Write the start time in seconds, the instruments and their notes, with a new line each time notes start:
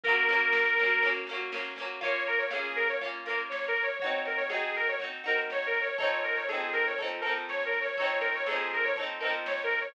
0.04 orchestral harp A#3 C#4, accordion A#4, kick, snare
0.08 orchestral harp F#3
0.17 snare
0.29 orchestral harp F#3 A#3 C#4, snare
0.41 snare
0.52 snare
0.66 snare
0.77 orchestral harp C#4, snare
0.81 orchestral harp F#3 A#3
0.91 snare
1.03 orchestral harp A#3 C#4, kick, snare
1.07 orchestral harp F#3
1.15 snare
1.27 orchestral harp C#4, snare
1.31 orchestral harp F#3 A#3
1.40 snare
1.52 orchestral harp F#3 A#3 C#4, snare
1.64 snare
1.76 orchestral harp A#3 C#4, snare
1.82 orchestral harp F#3
1.90 snare
2.01 orchestral harp A#3 C#4 F4, accordion C#5, kick, snare
2.15 snare
2.27 accordion A#4, snare
2.38 accordion C#5, snare
2.51 orchestral harp C#4 F4, accordion G#4, snare
2.55 orchestral harp A#3
2.64 snare
2.76 accordion A#4, snare
2.88 accordion C#5, snare
3.01 orchestral harp C#4 F4, kick, snare
3.05 orchestral harp A#3
3.13 snare
3.26 orchestral harp C#4 F4, accordion A#4, snare
3.30 orchestral harp A#3
3.38 snare
3.49 accordion C#5, snare
3.64 snare
3.68 accordion A#4
3.76 snare
3.83 accordion C#5
3.88 snare
3.99 orchestral harp F#4, accordion C#5, kick, snare
4.04 orchestral harp C4 D#4
4.13 snare
4.25 accordion A#4, snare
4.37 accordion C#5, snare
4.49 orchestral harp D#4 F#4, accordion G#4, snare
4.53 orchestral harp C4
4.62 snare
4.74 accordion A#4, snare
4.87 accordion C#5, snare
4.99 orchestral harp D#4 F#4, kick, snare
5.04 orchestral harp C4
5.11 snare
5.24 orchestral harp C4 D#4 F#4, accordion A#4, snare
5.37 snare
5.50 accordion C#5, snare
5.62 snare
5.66 accordion A#4
5.74 snare
5.81 accordion C#5
5.87 snare
5.98 orchestral harp C4 D#4 A4, accordion C#5, kick, snare
6.04 orchestral harp F3
6.11 snare
6.23 accordion A#4, snare
6.36 accordion C#5, snare
6.49 orchestral harp D#4 A4, accordion G#4, snare
6.53 orchestral harp F3 C4
6.60 snare
6.73 accordion A#4, snare
6.86 accordion C#5, snare
6.98 orchestral harp D#4 A4, kick, snare
7.02 orchestral harp F3 C4
7.09 snare
7.21 orchestral harp D#4 A4, accordion A#4, snare
7.26 orchestral harp F3 C4
7.36 snare
7.49 accordion C#5, snare
7.60 snare
7.65 accordion A#4
7.72 snare
7.81 accordion C#5
7.85 snare
7.97 orchestral harp D#4 A4, accordion C#5, kick, snare
8.02 orchestral harp F3 C4
8.10 snare
8.21 accordion A#4, snare
8.34 accordion C#5, snare
8.46 orchestral harp D#4 A4, accordion G#4, snare
8.51 orchestral harp F3 C4
8.59 snare
8.71 accordion A#4, snare
8.83 accordion C#5, snare
8.96 orchestral harp D#4 A4, kick, snare
9.01 orchestral harp F3 C4
9.08 snare
9.20 orchestral harp D#4 A4, accordion A#4, snare
9.24 orchestral harp F3 C4
9.33 snare
9.46 accordion C#5, snare
9.59 snare
9.63 accordion A#4
9.71 snare
9.81 accordion C#5, snare